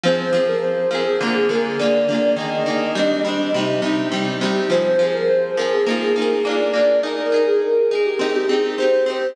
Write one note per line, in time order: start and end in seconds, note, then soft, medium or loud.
0.03 0.30 F3 loud
0.03 0.30 C4 medium
0.03 0.45 C5 medium
0.07 0.30 G#4 medium
0.33 0.86 F3 medium
0.33 0.86 C4 medium
0.37 0.86 G#4 medium
0.48 0.62 A#4 medium
0.62 0.90 C5 medium
0.91 1.17 F3 medium
0.91 1.17 C4 medium
0.91 1.05 A#4 medium
0.95 1.17 G#4 medium
1.05 1.19 G#4 medium
1.21 1.47 D3 loud
1.21 1.47 A#3 loud
1.25 1.47 F4 medium
1.25 1.47 G#4 medium
1.34 1.48 G#4 medium
1.49 1.76 D3 medium
1.49 1.76 A#3 medium
1.49 1.76 F4 medium
1.49 1.64 A#4 medium
1.55 1.76 G#4 medium
1.79 2.06 D3 medium
1.79 2.06 A#3 medium
1.79 2.35 D5 medium
1.83 2.06 F4 medium
1.83 2.06 G#4 medium
2.08 2.35 D3 medium
2.08 2.35 A#3 medium
2.08 2.35 F4 medium
2.14 2.35 G#4 medium
2.36 2.63 D#3 medium
2.36 2.63 A#3 medium
2.36 2.63 G#4 medium
2.36 3.36 D#5 loud
2.66 2.93 D#3 medium
2.66 2.93 A#3 medium
2.66 2.93 G#4 medium
2.95 3.22 G3 medium
2.95 3.22 C4 loud
2.99 3.22 D4 loud
3.25 3.51 G3 medium
3.25 3.51 C4 medium
3.29 3.51 D4 medium
3.54 3.81 C3 medium
3.54 3.81 G3 loud
3.58 3.81 D#4 medium
3.82 4.09 C3 medium
3.82 4.09 G3 medium
3.82 4.09 D#4 medium
4.12 4.38 C3 medium
4.12 4.38 G3 medium
4.12 4.38 D#4 medium
4.41 4.68 C3 medium
4.41 4.68 G3 medium
4.45 4.68 D#4 medium
4.70 4.96 F3 medium
4.70 4.96 C4 loud
4.70 5.06 C5 loud
4.74 4.96 G#4 medium
4.99 5.53 F3 loud
4.99 5.53 C4 medium
5.03 5.53 G#4 medium
5.13 5.27 A#4 medium
5.28 5.55 C5 loud
5.57 5.84 F3 medium
5.57 5.84 C4 medium
5.57 5.84 G#4 medium
5.57 5.71 A#4 medium
5.72 5.86 G#4 medium
5.86 6.13 A#3 loud
5.86 6.13 D#4 loud
5.90 6.13 F4 loud
5.90 6.13 G#4 loud
6.01 6.15 G#4 medium
6.16 6.43 A#3 medium
6.16 6.43 D#4 medium
6.16 6.29 A#4 medium
6.20 6.43 F4 medium
6.20 6.43 G#4 loud
6.45 6.72 A#3 loud
6.45 6.72 D4 loud
6.45 6.99 D5 medium
6.49 6.72 F4 loud
6.49 6.72 G#4 loud
6.73 7.00 A#3 medium
6.73 7.00 D4 medium
6.77 7.00 F4 medium
6.77 7.00 G#4 medium
7.03 7.30 D#4 loud
7.03 7.30 G#4 loud
7.03 7.43 A#4 loud
7.07 7.30 A#4 loud
7.32 7.86 D#4 medium
7.32 7.86 G#4 medium
7.36 7.86 A#4 medium
7.47 7.61 G#4 loud
7.62 7.89 A#4 medium
7.90 8.18 D#4 medium
7.90 8.04 G#4 medium
7.90 8.18 G#4 medium
7.95 8.18 A#4 medium
8.05 8.19 G4 medium
8.19 8.46 C4 loud
8.19 8.46 D#4 loud
8.23 8.46 G4 loud
8.35 8.49 G4 medium
8.49 8.76 C4 medium
8.49 8.76 D#4 medium
8.49 8.63 G#4 medium
8.53 8.76 G4 medium
8.78 9.05 C4 medium
8.78 9.05 D#4 medium
8.78 9.28 C5 loud
8.82 9.05 G4 medium
9.06 9.33 C4 medium
9.06 9.33 D#4 medium
9.06 9.33 G4 medium